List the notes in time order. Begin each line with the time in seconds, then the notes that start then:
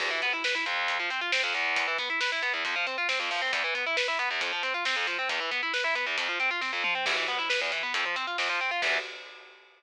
0.00 E2, kick, crash
0.11 E3
0.22 B3, kick, closed hi-hat
0.33 E4
0.44 B4, snare
0.55 E4
0.66 F2, closed hi-hat
0.88 kick, closed hi-hat
1.00 F3
1.10 C4, closed hi-hat
1.21 F4
1.32 C4, snare
1.43 F2
1.54 E2, closed hi-hat
1.76 kick, closed hi-hat
1.87 E3
1.98 B3, kick, closed hi-hat
2.10 E4
2.20 B4, snare
2.32 E4
2.43 B3, closed hi-hat
2.53 E2
2.65 F2, kick, closed hi-hat
2.76 F3
2.87 C4, closed hi-hat
2.98 F4
3.09 C4, snare
3.20 F2
3.31 F3, open hi-hat
3.42 C4
3.53 E2, kick, closed hi-hat
3.64 E3
3.75 B3, kick, closed hi-hat
3.86 E4
3.97 B4, snare
4.08 E4
4.19 B3, closed hi-hat
4.31 E2
4.41 F2, kick, closed hi-hat
4.53 F3
4.63 C4, closed hi-hat
4.74 F4
4.85 C4, snare
4.96 F2
5.07 F3, closed hi-hat
5.19 C4
5.29 E2, kick, closed hi-hat
5.40 E3
5.51 B3, kick, closed hi-hat
5.63 E4
5.74 B4, snare
5.84 E4
5.95 B3, closed hi-hat
6.06 E2
6.18 F2, kick, closed hi-hat
6.28 F3
6.40 C4, closed hi-hat
6.51 F4
6.61 C4, kick, snare
6.73 F2
6.84 F3, mid tom
6.95 C4
7.06 E2, kick, crash
7.17 E3
7.28 B3, kick, closed hi-hat
7.39 E4
7.50 B4, snare
7.61 E2
7.72 E3, closed hi-hat
7.83 B3
7.94 F2, kick, closed hi-hat
8.06 F3
8.16 C4, closed hi-hat
8.27 F4
8.38 F2, snare
8.49 F3
8.61 C4
8.71 F4
8.82 E2 E3 B3, kick, crash